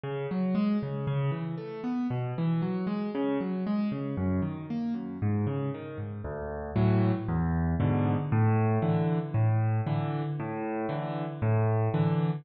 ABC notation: X:1
M:4/4
L:1/8
Q:1/4=116
K:Db
V:1 name="Acoustic Grand Piano"
D, G, A, D, ^C, =E, =A, =B, | _C, _F, G, A, D, G, A, D, | G,, E, B, G,, A,, D, E, A,, | [K:D] D,,2 [A,,E,F,]2 E,,2 [^G,,B,,D,]2 |
A,,2 [D,E,]2 A,,2 [D,E,]2 | A,,2 [D,E,]2 A,,2 [D,E,]2 |]